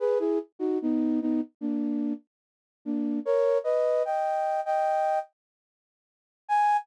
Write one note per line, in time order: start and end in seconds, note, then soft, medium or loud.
0.00 0.18 G#4 medium
0.00 0.18 B4 medium
0.19 0.39 E4 medium
0.19 0.39 G#4 medium
0.59 0.78 D#4 medium
0.59 0.78 F#4 medium
0.82 1.20 B3 medium
0.82 1.20 D#4 medium
1.21 1.41 B3 medium
1.21 1.41 D#4 medium
1.61 2.13 A#3 medium
1.61 2.13 D4 medium
2.85 3.19 A#3 medium
2.85 3.19 D4 medium
3.25 3.58 A#4 medium
3.25 3.58 C#5 medium
3.64 4.03 B4 medium
3.64 4.03 D#5 medium
4.05 4.61 D#5 medium
4.05 4.61 G5 medium
4.66 5.19 D#5 medium
4.66 5.19 G5 medium
6.48 6.77 G#5 loud